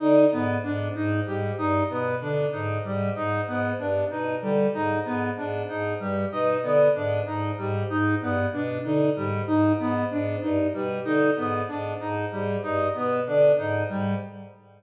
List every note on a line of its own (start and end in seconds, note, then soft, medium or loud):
0.00 0.26 D3 medium
0.00 0.25 D#4 medium
0.32 0.57 G#2 medium
0.32 0.57 B3 medium
0.63 0.89 G#2 medium
0.63 0.89 D4 medium
0.95 1.20 G#2 medium
0.95 1.20 D#4 medium
1.26 1.51 G#2 medium
1.26 1.51 G3 medium
1.58 1.83 G2 medium
1.58 1.83 D#4 medium
1.90 2.15 B2 medium
1.90 2.15 B3 medium
2.21 2.46 D3 medium
2.21 2.46 D4 medium
2.52 2.78 G#2 medium
2.52 2.78 D#4 medium
2.84 3.10 G#2 medium
2.84 3.09 G3 medium
3.15 3.41 G#2 medium
3.15 3.41 D#4 medium
3.47 3.72 G#2 medium
3.47 3.73 B3 medium
3.79 4.04 G2 medium
3.79 4.04 D4 medium
4.10 4.36 B2 medium
4.10 4.36 D#4 medium
4.42 4.67 D3 medium
4.42 4.67 G3 medium
4.74 4.99 G#2 medium
4.74 4.99 D#4 medium
5.05 5.30 G#2 medium
5.05 5.30 B3 medium
5.37 5.63 G#2 medium
5.37 5.62 D4 medium
5.68 5.93 G#2 medium
5.68 5.94 D#4 medium
6.00 6.25 G2 medium
6.00 6.25 G3 medium
6.32 6.57 B2 medium
6.32 6.57 D#4 medium
6.63 6.89 D3 medium
6.63 6.88 B3 medium
6.95 7.20 G#2 medium
6.95 7.20 D4 medium
7.26 7.51 G#2 medium
7.26 7.51 D#4 medium
7.58 7.83 G#2 medium
7.58 7.83 G3 medium
7.89 8.15 G#2 medium
7.89 8.15 D#4 medium
8.21 8.46 G2 medium
8.21 8.47 B3 medium
8.53 8.78 B2 medium
8.53 8.78 D4 medium
8.84 9.10 D3 medium
8.84 9.10 D#4 medium
9.16 9.41 G#2 medium
9.16 9.41 G3 medium
9.47 9.73 G#2 medium
9.47 9.72 D#4 medium
9.79 10.04 G#2 medium
9.79 10.04 B3 medium
10.11 10.36 G#2 medium
10.11 10.36 D4 medium
10.42 10.68 G2 medium
10.42 10.67 D#4 medium
10.74 10.99 B2 medium
10.74 10.99 G3 medium
11.05 11.31 D3 medium
11.05 11.30 D#4 medium
11.37 11.62 G#2 medium
11.37 11.62 B3 medium
11.68 11.93 G#2 medium
11.68 11.94 D4 medium
12.00 12.25 G#2 medium
12.00 12.25 D#4 medium
12.31 12.57 G#2 medium
12.31 12.57 G3 medium
12.63 12.88 G2 medium
12.63 12.88 D#4 medium
12.94 13.20 B2 medium
12.94 13.20 B3 medium
13.27 13.52 D3 medium
13.27 13.52 D4 medium
13.58 13.83 G#2 medium
13.58 13.83 D#4 medium
13.89 14.14 G#2 medium
13.89 14.14 G3 medium